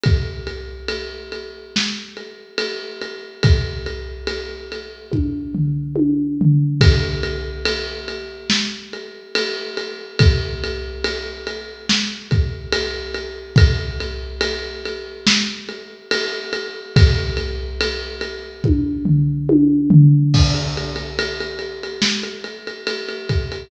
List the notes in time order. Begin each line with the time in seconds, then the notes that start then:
0.04 kick, ride
0.47 ride
0.88 ride
1.32 ride
1.76 snare
2.17 ride
2.58 ride
3.02 ride
3.43 kick, ride
3.86 ride
4.27 ride
4.72 ride
5.12 kick, high tom
5.55 floor tom
5.96 high tom
6.41 floor tom
6.81 kick, ride
7.23 ride
7.65 ride
8.08 ride
8.50 snare
8.93 ride
9.35 ride
9.77 ride
10.19 kick, ride
10.64 ride
11.04 ride
11.47 ride
11.89 snare
12.31 kick, ride
12.73 ride
13.14 ride
13.56 kick, ride
14.00 ride
14.41 ride
14.86 ride
15.27 snare
15.69 ride
16.11 ride
16.53 ride
16.96 kick, ride
17.37 ride
17.81 ride
18.21 ride
18.64 kick, high tom
19.05 floor tom
19.49 high tom
19.90 floor tom
20.34 kick, crash
20.55 ride
20.77 ride
20.96 ride
21.19 ride
21.40 ride
21.59 ride
21.83 ride
22.02 snare
22.23 ride
22.44 ride
22.67 ride
22.87 ride
23.09 ride
23.29 kick, ride
23.52 ride